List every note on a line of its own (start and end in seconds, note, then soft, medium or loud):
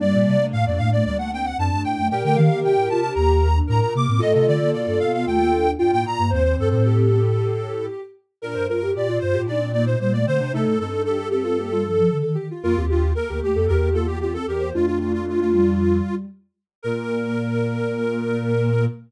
0.00 0.12 G2 medium
0.00 0.37 G3 medium
0.00 1.44 A#3 loud
0.00 1.44 D4 loud
0.00 0.46 D5 loud
0.13 0.26 A#2 loud
0.26 0.39 C3 medium
0.39 0.52 C3 medium
0.39 0.72 A3 medium
0.53 0.65 A2 medium
0.53 0.65 F5 loud
0.66 0.78 F2 medium
0.66 0.79 D5 medium
0.78 1.02 A2 medium
0.78 0.91 A3 medium
0.78 0.90 F5 loud
0.92 1.04 A3 medium
0.92 1.04 D5 loud
1.05 1.53 D2 medium
1.05 1.18 G3 medium
1.05 1.17 D5 loud
1.18 1.31 A3 medium
1.18 1.31 F#5 loud
1.32 1.57 C4 medium
1.32 1.46 G5 loud
1.45 1.57 F#5 loud
1.58 1.70 F#2 medium
1.58 1.70 C4 medium
1.58 2.02 D4 loud
1.58 1.82 A5 loud
1.71 1.84 G2 medium
1.71 1.97 A3 medium
1.84 1.97 A2 medium
1.84 2.08 G5 loud
1.97 2.10 F#2 medium
1.97 2.10 A3 medium
2.11 2.23 A#2 medium
2.11 3.47 G4 loud
2.11 3.47 A#4 loud
2.11 2.23 G5 loud
2.23 2.36 D3 medium
2.23 2.36 A3 medium
2.23 2.37 G5 loud
2.36 2.49 D#3 loud
2.36 2.49 A#3 medium
2.36 2.60 F5 medium
2.50 2.63 D#3 medium
2.50 2.63 A#3 medium
2.63 2.76 C3 medium
2.63 2.88 G4 medium
2.63 2.89 G5 medium
2.76 2.89 A2 medium
2.89 3.10 C3 medium
2.89 3.02 F4 medium
2.89 3.00 A5 loud
3.01 3.15 D4 medium
3.01 3.13 A5 medium
3.15 3.61 D#2 medium
3.15 3.40 A#3 medium
3.15 3.59 A#5 medium
3.42 3.55 A#3 medium
3.55 3.68 D4 medium
3.67 3.81 A2 medium
3.67 3.81 D4 medium
3.67 4.16 A#4 loud
3.67 3.80 A#5 medium
3.81 3.94 A#2 medium
3.81 3.93 A#5 medium
3.95 4.07 C3 medium
3.95 4.07 A#3 medium
3.95 4.21 D6 medium
4.08 4.21 A2 medium
4.08 4.21 C4 medium
4.19 4.34 A2 loud
4.19 4.56 A3 medium
4.19 5.66 F4 loud
4.19 5.66 A4 loud
4.19 4.33 D#5 loud
4.34 4.47 C3 medium
4.34 4.46 D#5 medium
4.47 4.60 D3 medium
4.47 4.70 D5 loud
4.61 4.73 D3 loud
4.61 4.96 A#3 medium
4.73 4.86 B2 medium
4.73 4.99 D5 medium
4.87 4.99 G2 medium
5.00 5.24 B2 medium
5.00 5.12 B3 medium
5.00 5.12 F5 loud
5.13 5.26 B3 medium
5.13 5.26 F5 medium
5.26 5.75 D#2 medium
5.26 5.39 A3 medium
5.26 5.71 G5 loud
5.40 5.52 A#3 medium
5.53 5.74 D4 medium
5.79 5.92 G2 medium
5.79 5.91 D4 medium
5.79 6.22 F4 loud
5.79 5.91 G5 medium
5.92 6.05 A2 medium
5.92 6.15 A#3 medium
5.92 6.05 G5 loud
6.05 6.18 A#2 medium
6.05 6.31 A#5 loud
6.18 6.31 G2 medium
6.18 6.31 A#3 medium
6.30 6.55 D#2 loud
6.30 7.18 C4 medium
6.30 6.67 C5 loud
6.30 6.43 C5 loud
6.44 6.56 C5 loud
6.58 6.70 G2 medium
6.58 6.69 A4 loud
6.69 7.88 A2 medium
6.69 7.86 A4 medium
6.69 6.83 C5 loud
6.85 8.01 G4 loud
8.42 8.54 A#2 loud
8.42 8.66 D4 medium
8.42 8.67 A#4 loud
8.42 8.56 A#4 loud
8.54 8.68 G2 medium
8.54 8.66 C5 medium
8.68 8.91 G2 medium
8.68 8.81 F4 medium
8.68 8.91 A#4 medium
8.68 8.93 A#4 loud
8.82 8.94 G4 medium
8.95 9.18 A#2 medium
8.95 9.07 G4 medium
8.95 9.19 D5 medium
9.09 9.34 F4 loud
9.19 9.33 G2 medium
9.19 9.34 F4 medium
9.19 9.42 C5 loud
9.34 9.47 A2 medium
9.34 9.47 F4 medium
9.34 9.47 G4 loud
9.47 9.96 A#2 loud
9.47 9.69 D4 loud
9.47 9.60 D#4 medium
9.47 9.72 D5 medium
9.61 9.73 C4 medium
9.73 9.86 A#3 medium
9.73 9.96 D#4 medium
9.73 9.85 D5 loud
9.86 9.99 A#3 medium
9.86 9.99 C5 loud
9.99 10.25 A#2 medium
9.99 10.13 G3 medium
9.99 10.21 A#3 loud
9.99 10.13 C5 medium
10.13 10.26 A3 medium
10.13 10.25 D5 loud
10.26 10.39 D3 medium
10.26 10.39 A3 medium
10.26 10.38 C4 medium
10.26 10.52 C5 loud
10.40 10.52 C3 medium
10.40 10.53 D4 loud
10.53 10.65 C3 loud
10.53 10.77 A3 medium
10.53 10.75 D#4 loud
10.53 10.79 A4 loud
10.66 10.78 A2 medium
10.79 12.02 G2 medium
10.79 10.91 C4 medium
10.79 11.05 D#4 loud
10.79 11.02 A4 loud
10.92 11.05 D4 medium
11.05 11.18 D4 medium
11.05 11.19 G4 medium
11.05 11.28 A4 loud
11.20 11.30 G4 medium
11.31 11.44 C4 medium
11.31 11.43 G4 loud
11.31 12.17 A4 loud
11.44 11.57 C4 medium
11.44 11.56 F4 loud
11.58 11.70 A#3 medium
11.58 11.71 G4 loud
11.71 11.84 G3 medium
11.71 11.85 F4 loud
11.84 11.97 F3 medium
11.84 12.09 A4 loud
11.97 12.10 F3 medium
12.11 12.23 D3 medium
12.11 12.22 A4 loud
12.23 12.36 D#3 medium
12.23 12.35 A4 medium
12.35 12.49 D#3 medium
12.35 12.47 G4 loud
12.51 12.63 F4 medium
12.63 12.76 F2 loud
12.63 12.76 A#3 medium
12.63 12.85 F4 loud
12.63 12.76 A#4 loud
12.76 13.13 D#2 medium
12.76 12.89 C4 medium
12.76 12.88 G4 loud
12.89 13.02 D4 medium
12.89 13.13 F4 medium
12.89 13.11 G4 loud
13.15 13.28 A#3 medium
13.15 13.29 A4 loud
13.15 13.40 A#4 loud
13.29 13.41 D2 medium
13.29 13.41 A#3 medium
13.29 13.55 G4 loud
13.42 13.54 D#2 medium
13.42 13.55 A3 medium
13.42 13.66 G4 medium
13.55 13.68 F2 medium
13.55 13.68 A#3 medium
13.55 13.68 A4 loud
13.68 14.38 E2 loud
13.68 13.90 A#3 medium
13.68 13.94 G4 loud
13.68 13.89 A#4 loud
13.94 14.17 A#3 medium
13.94 14.06 F4 loud
13.94 14.07 A4 loud
14.06 14.19 F4 medium
14.06 14.19 G4 loud
14.21 14.34 C4 medium
14.21 14.36 F4 medium
14.21 14.33 G4 medium
14.34 14.47 C4 medium
14.34 14.46 A4 medium
14.34 14.46 A4 loud
14.47 14.72 E2 medium
14.47 14.70 G4 loud
14.47 14.61 A#4 loud
14.60 14.73 A#3 medium
14.60 14.73 C5 medium
14.74 16.01 F2 medium
14.74 15.20 A3 medium
14.74 15.93 D4 medium
14.74 15.93 F4 loud
14.74 14.86 F4 loud
14.86 14.99 F4 loud
15.00 15.12 F4 medium
15.13 15.26 F4 loud
15.26 15.39 A3 medium
15.26 15.40 F4 medium
15.39 15.52 A3 medium
15.39 16.15 F4 loud
15.53 16.25 G3 medium
16.82 18.87 A#2 loud
16.82 18.87 A#3 loud
16.82 18.85 A#4 loud
16.82 18.86 A#4 loud